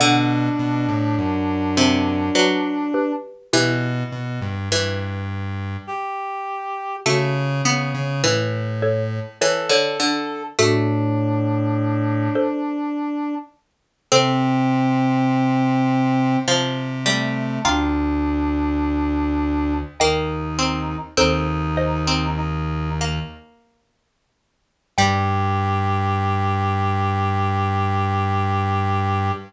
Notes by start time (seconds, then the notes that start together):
0.00 B2 D3 D4 D5 F#5
0.59 B2
0.88 A2
1.18 F#2
1.77 C3
2.35 F#3 B4 D5
2.94 G4 B4
3.53 B2 E3 E4 G4
4.12 B2
4.41 G2
4.71 G2 E3
5.87 G4
7.06 C#3 A3 F#4 A4
7.65 C#3 B3
7.94 C#3
8.24 A2 E3
8.82 A4 C#5
9.41 E3 A4 C#5
9.69 D3 A4 C#5
10.00 D3
10.59 A2 A3 D4 F#4 A4
12.35 A4 C5
14.12 C3 C4 A4 C5
16.47 C3 F3
17.05 G3 A3
17.65 D2 D4 F4 G5 A#5
19.99 D#2 A#3 D#4 D#5 G5
20.59 C4
21.17 D#2 C4 D#4 A4 C5
21.77 C5 D#5
22.07 C4
22.37 D#4
23.01 A#3
24.98 G2 G3 G4 G5